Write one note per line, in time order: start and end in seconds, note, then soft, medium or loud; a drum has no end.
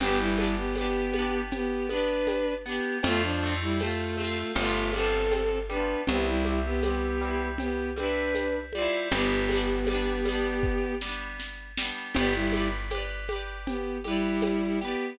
0.00 2.80 G1 medium
0.00 0.18 B3 medium
0.00 0.35 B3 medium
0.00 0.35 D4 medium
0.00 0.18 G4 loud
0.00 crash medium
0.00 cowbell medium
0.00 low conga medium
0.00 shaker medium
0.07 0.35 G4 loud
0.19 0.55 G3 medium
0.19 0.55 E4 medium
0.37 0.72 B3 medium
0.37 0.72 D4 medium
0.37 high conga medium
0.37 shaker medium
0.44 0.72 G4 medium
0.57 0.75 B3 medium
0.57 0.75 G4 medium
0.75 1.41 B3 medium
0.75 1.13 B3 medium
0.75 1.41 G4 medium
0.75 tambourine medium
0.75 cowbell medium
0.75 high conga medium
0.75 shaker medium
0.81 1.13 D4 medium
0.81 1.13 G4 medium
1.13 1.85 B3 medium
1.13 high conga medium
1.13 shaker medium
1.19 1.85 D4 medium
1.19 1.85 G4 medium
1.51 1.87 B3 medium
1.51 1.87 G4 medium
1.51 cowbell medium
1.51 low conga medium
1.51 shaker medium
1.89 2.60 B3 medium
1.89 2.54 D4 medium
1.89 2.54 B4 medium
1.89 high conga medium
1.89 shaker medium
1.94 2.60 D4 medium
1.94 2.60 G4 medium
2.27 tambourine medium
2.27 cowbell medium
2.27 high conga medium
2.27 shaker medium
2.66 3.01 B3 medium
2.66 2.98 B3 medium
2.66 3.01 D4 medium
2.66 2.98 G4 medium
2.66 shaker medium
2.73 3.01 G4 medium
3.03 4.44 F2 medium
3.03 3.38 A3 medium
3.03 3.22 A3 loud
3.03 3.38 C4 medium
3.03 3.22 F4 loud
3.03 cowbell medium
3.03 low conga medium
3.03 shaker medium
3.10 3.38 F4 medium
3.23 3.54 F3 medium
3.23 3.54 D4 medium
3.42 3.78 A3 medium
3.42 shaker soft
3.46 3.78 C4 medium
3.46 3.78 F4 medium
3.61 3.79 G3 medium
3.61 3.79 E4 medium
3.80 4.52 A3 medium
3.80 4.16 A3 medium
3.80 4.52 F4 medium
3.80 tambourine medium
3.80 cowbell medium
3.80 high conga medium
3.80 shaker medium
3.84 4.16 C4 medium
3.84 4.16 F4 medium
4.17 4.53 A3 medium
4.17 4.53 C4 medium
4.17 high conga medium
4.17 shaker medium
4.24 4.53 F4 medium
4.55 5.96 G1 medium
4.55 4.90 G3 medium
4.55 4.91 A3 medium
4.55 4.90 B3 medium
4.55 4.91 F4 medium
4.55 cowbell medium
4.55 low conga medium
4.55 shaker medium
4.62 4.90 D4 medium
4.62 4.90 F4 medium
4.93 5.64 G3 medium
4.93 5.59 C4 medium
4.93 5.59 A4 medium
4.93 high conga medium
4.93 shaker medium
4.97 5.64 B3 medium
4.97 5.64 D4 medium
5.04 5.64 F4 medium
5.31 tambourine medium
5.31 cowbell medium
5.31 high conga medium
5.31 shaker medium
5.69 6.05 G3 medium
5.69 6.05 B3 medium
5.69 6.01 D4 medium
5.69 6.01 B4 medium
5.69 high conga medium
5.69 shaker medium
5.77 6.05 D4 medium
5.77 6.05 F4 medium
6.07 8.88 C2 medium
6.07 6.43 G3 medium
6.07 6.26 B3 medium
6.07 6.26 G4 medium
6.07 cowbell medium
6.07 low conga medium
6.07 shaker medium
6.12 6.43 C4 medium
6.12 6.43 E4 medium
6.27 6.59 G3 medium
6.27 6.59 E4 medium
6.45 6.81 G3 medium
6.45 high conga medium
6.45 shaker medium
6.49 6.81 C4 medium
6.49 6.81 E4 medium
6.65 6.83 B3 medium
6.65 6.83 G4 medium
6.83 7.18 G3 medium
6.83 7.48 B3 medium
6.83 7.18 C4 medium
6.83 7.48 G4 medium
6.83 tambourine medium
6.83 cowbell medium
6.83 high conga medium
6.83 shaker medium
6.90 7.18 E4 medium
7.21 7.91 G3 medium
7.21 7.91 C4 medium
7.21 shaker medium
7.28 7.91 E4 medium
7.58 7.90 B3 medium
7.58 7.90 G4 medium
7.58 cowbell medium
7.58 low conga medium
7.58 shaker medium
7.96 8.66 G3 medium
7.96 8.66 C4 medium
7.96 8.59 D4 medium
7.96 8.59 B4 medium
7.96 high conga medium
7.96 shaker medium
8.03 8.66 E4 medium
8.34 tambourine medium
8.34 cowbell medium
8.34 high conga medium
8.34 shaker medium
8.73 9.10 G3 medium
8.73 9.08 F4 medium
8.73 9.08 D5 medium
8.73 high conga medium
8.73 shaker medium
8.78 9.10 C4 medium
8.78 9.10 E4 medium
9.11 11.91 G1 medium
9.11 9.46 G3 medium
9.11 10.94 B3 medium
9.11 9.46 B3 medium
9.11 10.94 G4 medium
9.11 cowbell medium
9.11 low conga medium
9.11 shaker medium
9.18 9.46 D4 medium
9.49 9.84 G3 medium
9.49 9.84 B3 medium
9.49 high conga medium
9.49 shaker medium
9.55 9.84 D4 medium
9.86 10.23 G3 medium
9.86 tambourine medium
9.86 cowbell medium
9.86 high conga medium
9.86 shaker medium
9.91 10.23 B3 medium
9.91 10.23 D4 medium
10.25 10.95 G3 medium
10.25 high conga medium
10.25 shaker medium
10.29 10.95 B3 medium
10.29 10.95 D4 medium
10.63 kick medium
11.01 11.72 G3 medium
11.01 11.72 B3 medium
11.01 snare medium
11.09 11.72 D4 medium
11.40 snare medium
11.78 12.13 G3 medium
11.78 snare loud
11.82 12.13 B3 medium
11.82 12.13 D4 medium
12.14 14.95 G1 medium
12.14 12.33 B3 medium
12.14 12.49 G4 medium
12.14 12.33 G4 loud
12.14 12.49 B4 medium
12.14 crash medium
12.14 cowbell medium
12.14 low conga medium
12.14 shaker medium
12.21 12.49 D5 loud
12.34 12.68 G3 medium
12.34 12.68 E4 medium
12.53 12.88 G4 medium
12.53 high conga medium
12.53 shaker medium
12.57 12.88 B4 medium
12.57 12.88 D5 medium
12.90 13.26 G4 medium
12.90 tambourine medium
12.90 cowbell medium
12.90 high conga medium
12.90 shaker medium
12.95 13.26 B4 medium
12.95 13.26 D5 medium
13.29 13.99 G4 medium
13.29 13.99 B4 medium
13.29 high conga medium
13.29 shaker medium
13.36 13.99 D5 medium
13.67 13.98 B3 medium
13.67 13.98 G4 medium
13.67 cowbell medium
13.67 low conga medium
13.67 shaker medium
14.04 14.79 G3 medium
14.04 14.79 E4 medium
14.04 14.74 G4 medium
14.04 14.74 B4 medium
14.04 high conga medium
14.04 shaker medium
14.11 14.74 D5 medium
14.42 tambourine medium
14.42 cowbell medium
14.42 high conga medium
14.42 shaker medium
14.81 15.18 B3 medium
14.81 15.16 G4 medium
14.81 15.18 G4 medium
14.81 15.16 B4 medium
14.81 shaker medium
14.88 15.16 D5 medium